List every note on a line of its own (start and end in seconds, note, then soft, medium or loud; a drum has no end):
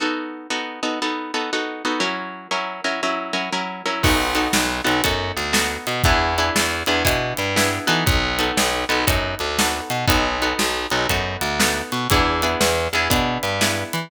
0.00 0.47 B3 medium
0.00 0.47 D#4 medium
0.00 0.47 F#4 medium
0.00 0.47 A4 medium
0.50 0.80 B3 medium
0.50 0.80 D#4 medium
0.50 0.80 F#4 medium
0.50 0.80 A4 medium
0.83 0.99 B3 medium
0.83 0.99 D#4 medium
0.83 0.99 F#4 medium
0.83 0.99 A4 medium
1.02 1.32 B3 medium
1.02 1.32 D#4 medium
1.02 1.32 F#4 medium
1.02 1.32 A4 medium
1.34 1.51 B3 medium
1.34 1.51 D#4 medium
1.34 1.51 F#4 medium
1.34 1.51 A4 medium
1.53 1.83 B3 medium
1.53 1.83 D#4 medium
1.53 1.83 F#4 medium
1.53 1.83 A4 medium
1.85 2.01 B3 medium
1.85 2.01 D#4 medium
1.85 2.01 F#4 medium
1.85 2.01 A4 medium
2.00 2.48 F#3 medium
2.00 2.48 C#4 medium
2.00 2.48 E4 medium
2.00 2.48 A#4 medium
2.51 2.81 F#3 medium
2.51 2.81 C#4 medium
2.51 2.81 E4 medium
2.51 2.81 A#4 medium
2.84 3.01 F#3 medium
2.84 3.01 C#4 medium
2.84 3.01 E4 medium
2.84 3.01 A#4 medium
3.03 3.33 F#3 medium
3.03 3.33 C#4 medium
3.03 3.33 E4 medium
3.03 3.33 A#4 medium
3.33 3.50 F#3 medium
3.33 3.50 C#4 medium
3.33 3.50 E4 medium
3.33 3.50 A#4 medium
3.53 3.82 F#3 medium
3.53 3.82 C#4 medium
3.53 3.82 E4 medium
3.53 3.82 A#4 medium
3.86 4.02 F#3 medium
3.86 4.02 C#4 medium
3.86 4.02 E4 medium
3.86 4.02 A#4 medium
4.03 4.48 B1 medium
4.03 4.34 B3 medium
4.03 4.34 D#4 medium
4.03 4.34 F#4 medium
4.03 4.34 A4 medium
4.03 kick medium
4.03 crash medium
4.35 4.80 B3 medium
4.35 4.80 D#4 medium
4.35 4.80 F#4 medium
4.35 4.80 A4 medium
4.35 closed hi-hat medium
4.53 4.81 B1 medium
4.53 snare loud
4.84 5.02 B1 medium
4.84 5.01 B3 medium
4.84 5.01 D#4 medium
4.84 5.01 F#4 medium
4.84 5.01 A4 medium
4.84 closed hi-hat medium
5.04 5.32 F#2 medium
5.04 5.52 B3 medium
5.04 5.52 D#4 medium
5.04 5.52 F#4 medium
5.04 5.52 A4 medium
5.04 kick medium
5.04 closed hi-hat medium
5.37 5.77 D2 medium
5.37 closed hi-hat medium
5.53 6.01 B3 medium
5.53 6.01 D#4 medium
5.53 6.01 F#4 medium
5.53 6.01 A4 medium
5.53 snare loud
5.87 6.02 B2 medium
5.87 closed hi-hat medium
6.04 6.50 E2 loud
6.04 6.35 B3 medium
6.04 6.35 D4 medium
6.04 6.35 E4 medium
6.04 6.35 G#4 medium
6.04 kick loud
6.04 closed hi-hat medium
6.38 6.84 B3 medium
6.38 6.84 D4 medium
6.38 6.84 E4 medium
6.38 6.84 G#4 medium
6.38 closed hi-hat medium
6.56 6.83 E2 medium
6.56 snare loud
6.86 7.03 E2 medium
6.86 7.04 B3 medium
6.86 7.04 D4 medium
6.86 7.04 E4 medium
6.86 7.04 G#4 medium
6.86 closed hi-hat medium
7.05 7.33 B2 medium
7.05 7.52 B3 medium
7.05 7.52 D4 medium
7.05 7.52 E4 medium
7.05 7.52 G#4 medium
7.05 kick medium
7.05 closed hi-hat loud
7.37 7.79 G2 medium
7.37 closed hi-hat medium
7.56 7.87 B3 medium
7.56 7.87 D4 medium
7.56 7.87 E4 medium
7.56 7.87 G#4 medium
7.56 snare medium
7.87 8.04 E3 medium
7.87 8.35 B3 medium
7.87 8.35 D#4 medium
7.87 8.35 F#4 medium
7.87 8.35 A4 medium
7.87 closed hi-hat medium
8.06 8.51 B1 loud
8.06 kick loud
8.06 closed hi-hat medium
8.39 8.84 B3 medium
8.39 8.84 D#4 medium
8.39 8.84 F#4 medium
8.39 8.84 A4 medium
8.39 closed hi-hat medium
8.57 8.85 B1 medium
8.57 snare loud
8.89 9.05 B1 medium
8.89 9.06 B3 medium
8.89 9.06 D#4 medium
8.89 9.06 F#4 medium
8.89 9.06 A4 medium
8.89 closed hi-hat medium
9.07 9.35 F#2 medium
9.07 9.55 B3 medium
9.07 9.55 D#4 medium
9.07 9.55 F#4 medium
9.07 9.55 A4 medium
9.07 kick medium
9.07 closed hi-hat loud
9.39 9.81 D2 medium
9.39 closed hi-hat medium
9.59 10.07 B3 medium
9.59 10.07 D#4 medium
9.59 10.07 F#4 medium
9.59 10.07 A4 medium
9.59 snare loud
9.90 10.06 B2 medium
9.90 closed hi-hat medium
10.07 10.53 B1 medium
10.07 10.37 B3 medium
10.07 10.37 D#4 medium
10.07 10.37 F#4 medium
10.07 10.37 A4 medium
10.07 kick medium
10.07 closed hi-hat medium
10.42 10.87 B3 medium
10.42 10.87 D#4 medium
10.42 10.87 F#4 medium
10.42 10.87 A4 medium
10.42 closed hi-hat medium
10.59 10.87 B1 medium
10.59 snare medium
10.90 11.07 B1 medium
10.90 11.08 B3 medium
10.90 11.08 D#4 medium
10.90 11.08 F#4 medium
10.90 11.08 A4 medium
10.90 closed hi-hat medium
11.09 11.37 F#2 medium
11.09 11.57 B3 medium
11.09 11.57 D#4 medium
11.09 11.57 F#4 medium
11.09 11.57 A4 medium
11.09 kick medium
11.09 closed hi-hat medium
11.41 11.82 D2 medium
11.41 closed hi-hat medium
11.60 12.07 B3 medium
11.60 12.07 D#4 medium
11.60 12.07 F#4 medium
11.60 12.07 A4 medium
11.60 snare loud
11.92 12.08 B2 medium
11.92 closed hi-hat medium
12.10 12.55 E2 medium
12.10 12.41 B3 medium
12.10 12.41 D4 medium
12.10 12.41 E4 medium
12.10 12.41 G#4 medium
12.10 kick medium
12.10 closed hi-hat medium
12.42 12.88 B3 medium
12.42 12.88 D4 medium
12.42 12.88 E4 medium
12.42 12.88 G#4 medium
12.42 closed hi-hat medium
12.61 12.88 E2 medium
12.61 snare loud
12.93 13.08 E2 medium
12.93 13.10 B3 medium
12.93 13.10 D4 medium
12.93 13.10 E4 medium
12.93 13.10 G#4 medium
12.93 closed hi-hat medium
13.10 13.38 B2 medium
13.10 13.58 B3 medium
13.10 13.58 D4 medium
13.10 13.58 E4 medium
13.10 13.58 G#4 medium
13.10 kick medium
13.10 closed hi-hat medium
13.43 13.84 G2 medium
13.43 closed hi-hat medium
13.61 14.09 B3 medium
13.61 14.09 D4 medium
13.61 14.09 E4 medium
13.61 14.09 G#4 medium
13.61 snare medium
13.93 14.09 E3 medium
13.93 closed hi-hat medium